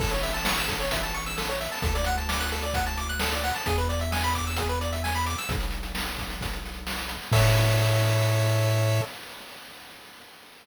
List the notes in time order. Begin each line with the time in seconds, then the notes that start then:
0.00 A1 A4, kick, crash
0.11 C#5, closed hi-hat
0.23 E5, closed hi-hat
0.34 A5, closed hi-hat
0.45 C#6, snare
0.57 E6, closed hi-hat
0.68 A4, kick, closed hi-hat
0.80 C#5, closed hi-hat
0.91 E5, kick, closed hi-hat
1.03 A5, closed hi-hat
1.14 C#6, closed hi-hat
1.26 E6, closed hi-hat
1.38 A4, snare
1.49 C#5, closed hi-hat
1.60 E5, closed hi-hat
1.72 A5, snare, open hi-hat
1.82 D2 A4, kick, closed hi-hat
1.95 D5, closed hi-hat
2.04 F#5, closed hi-hat
2.18 A5, closed hi-hat
2.29 D6, snare
2.40 F#6, closed hi-hat
2.52 A4, closed hi-hat
2.62 D5, closed hi-hat
2.74 F#5, kick, closed hi-hat
2.86 A5, closed hi-hat
2.97 D6, closed hi-hat
3.09 F#6, closed hi-hat
3.19 A4, snare
3.32 D5, closed hi-hat
3.44 F#5, closed hi-hat
3.54 A5, snare, open hi-hat
3.66 E2 G#4, kick, closed hi-hat
3.78 B4, closed hi-hat
3.89 D5, closed hi-hat
3.99 E5, closed hi-hat
4.12 G#5, snare
4.22 B5, closed hi-hat
4.33 D6, kick, closed hi-hat
4.47 E6, closed hi-hat
4.56 G#4, kick, closed hi-hat
4.69 B4, closed hi-hat
4.81 D5, closed hi-hat
4.93 E5, closed hi-hat
5.04 G#5, snare
5.14 B5, closed hi-hat
5.26 D6, closed hi-hat
5.38 E6, snare, closed hi-hat
5.49 B1, kick, closed hi-hat
5.60 closed hi-hat
5.71 closed hi-hat
5.83 closed hi-hat
5.95 snare
6.05 closed hi-hat
6.18 kick, closed hi-hat
6.30 closed hi-hat
6.41 kick, closed hi-hat
6.53 closed hi-hat
6.65 closed hi-hat
6.74 closed hi-hat
6.87 snare
6.98 closed hi-hat
7.09 closed hi-hat
7.22 snare, closed hi-hat
7.32 A2 A4 C#5 E5, kick, crash